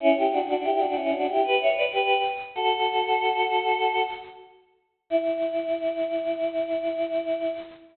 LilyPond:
\new Staff { \time 4/4 \key e \dorian \tempo 4 = 94 <cis' e'>16 <e' g'>16 <d' fis'>16 <d' fis'>16 <e' g'>16 <d' fis'>16 <cis' e'>16 <d' fis'>16 <e' g'>16 <g' b'>16 <cis'' e''>16 <b' d''>16 <g' b'>8 r8 | <fis' a'>2~ <fis' a'>8 r4. | e'1 | }